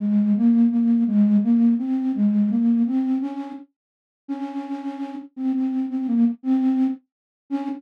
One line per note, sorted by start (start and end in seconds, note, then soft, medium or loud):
0.00 0.33 G#3 medium
0.36 0.67 A#3 medium
0.71 1.04 A#3 medium
1.07 1.37 G#3 medium
1.43 1.74 A#3 medium
1.79 2.12 C4 medium
2.15 2.50 G#3 medium
2.50 2.83 A#3 medium
2.86 3.18 C4 medium
3.21 3.52 C#4 medium
4.28 5.15 C#4 medium
5.36 5.52 C4 medium
5.53 5.86 C4 medium
5.90 6.07 C4 medium
6.08 6.25 A#3 medium
6.43 6.87 C4 medium
7.50 7.69 C#4 loud